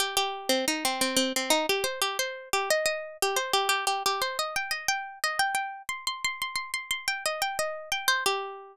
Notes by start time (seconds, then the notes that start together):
0.00 G4
0.17 G4
0.49 C4
0.68 D#4
0.85 C4
1.01 C4
1.17 C4
1.36 C4
1.50 D#4
1.69 G4
1.84 C5
2.02 G4
2.19 C5
2.53 G4
2.71 D#5
2.86 D#5
3.22 G4
3.36 C5
3.53 G4
3.69 G4
3.87 G4
4.06 G4
4.22 C5
4.39 D#5
4.56 G5
4.71 D#5
4.88 G5
5.24 D#5
5.39 G5
5.55 G5
5.89 C6
6.07 C6
6.25 C6
6.42 C6
6.56 C6
6.74 C6
6.91 C6
7.08 G5
7.26 D#5
7.42 G5
7.59 D#5
7.92 G5
8.08 C5
8.26 G4